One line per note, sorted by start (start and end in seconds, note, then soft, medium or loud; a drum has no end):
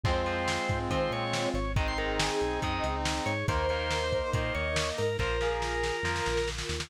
0.03 0.58 F2 medium
0.03 0.22 F3 medium
0.03 1.51 G#3 medium
0.03 1.74 C4 medium
0.03 1.51 C4 medium
0.03 1.59 C4 loud
0.03 0.22 C4 medium
0.03 1.74 F4 medium
0.03 1.59 F4 medium
0.03 0.79 C5 medium
0.03 kick loud
0.03 crash loud
0.26 0.61 F3 medium
0.26 0.61 C4 medium
0.26 closed hi-hat medium
0.48 snare loud
0.69 0.88 G#2 medium
0.69 kick loud
0.69 closed hi-hat medium
0.90 1.08 D#3 medium
0.90 1.25 F3 medium
0.90 1.25 C4 medium
0.90 1.11 C5 medium
0.90 kick medium
0.90 closed hi-hat loud
1.11 1.47 A#2 medium
1.11 1.49 C#5 medium
1.11 closed hi-hat medium
1.33 snare loud
1.54 2.30 G#1 loud
1.54 1.72 C#5 medium
1.54 closed hi-hat medium
1.76 1.93 D#3 medium
1.76 1.93 G#3 loud
1.76 3.32 C4 medium
1.76 3.32 D#4 medium
1.76 3.46 D#4 medium
1.76 3.46 G#4 medium
1.76 1.86 D#5 medium
1.76 kick loud
1.76 closed hi-hat loud
1.88 1.98 C6 medium
1.98 2.32 D#3 medium
1.98 2.32 G#3 medium
1.98 2.18 A#4 medium
1.98 closed hi-hat medium
2.19 2.59 G#4 medium
2.19 snare loud
2.41 2.59 B1 medium
2.41 closed hi-hat medium
2.62 2.80 F#2 medium
2.62 2.97 D#3 medium
2.62 2.97 G#3 medium
2.62 2.95 D#5 medium
2.62 kick loud
2.62 closed hi-hat loud
2.83 3.20 C#2 medium
2.83 closed hi-hat loud
3.05 snare loud
3.26 3.44 G#2 medium
3.26 3.46 C#5 medium
3.26 closed hi-hat medium
3.48 4.21 D#2 loud
3.48 3.66 D#3 loud
3.48 5.02 A#3 loud
3.48 3.66 A#3 loud
3.48 5.02 D#4 medium
3.48 5.18 D#4 medium
3.48 3.67 A#4 medium
3.48 5.18 A#4 medium
3.48 4.30 C5 medium
3.48 kick loud
3.48 closed hi-hat loud
3.69 4.04 D#3 medium
3.69 4.04 A#3 medium
3.69 3.99 A#4 medium
3.69 closed hi-hat medium
3.91 snare loud
4.01 4.12 C5 medium
4.12 4.22 A#4 medium
4.12 kick medium
4.12 closed hi-hat medium
4.23 4.33 C5 medium
4.33 4.51 A#2 medium
4.33 4.69 D#3 medium
4.33 4.69 A#3 medium
4.33 4.53 C5 medium
4.33 5.09 D#5 medium
4.33 kick loud
4.33 closed hi-hat loud
4.54 4.92 D#2 medium
4.54 4.89 C#5 medium
4.54 closed hi-hat medium
4.76 snare loud
4.98 5.17 G#2 medium
4.98 5.17 A#4 medium
4.98 open hi-hat medium
5.19 5.92 A#1 loud
5.19 5.37 F3 medium
5.19 5.37 A#3 medium
5.19 6.89 F4 medium
5.19 6.89 A#4 medium
5.19 6.49 A#4 medium
5.19 5.39 C5 medium
5.19 kick medium
5.19 snare medium
5.41 5.75 F3 medium
5.41 5.75 A#3 medium
5.41 5.96 G#4 medium
5.41 snare medium
5.62 snare medium
5.83 snare loud
6.03 6.21 F2 medium
6.03 6.39 F3 medium
6.03 6.39 A#3 medium
6.03 6.45 A#4 medium
6.03 snare medium
6.16 snare medium
6.26 6.63 A#1 medium
6.26 snare medium
6.37 snare medium
6.48 snare medium
6.58 snare loud
6.69 6.87 D#2 medium
6.69 snare loud
6.80 snare loud